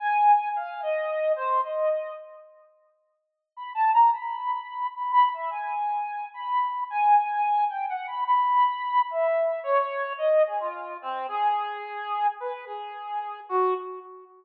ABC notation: X:1
M:5/8
L:1/16
Q:1/4=109
K:none
V:1 name="Brass Section"
^g4 f2 ^d4 | c2 ^d4 z4 | z6 (3b2 a2 ^a2 | b6 (3b2 b2 e2 |
^g6 b4 | ^g6 (3=g2 ^f2 b2 | b6 e4 | ^c4 ^d2 ^G F3 |
C2 ^G8 | B2 ^G6 ^F2 |]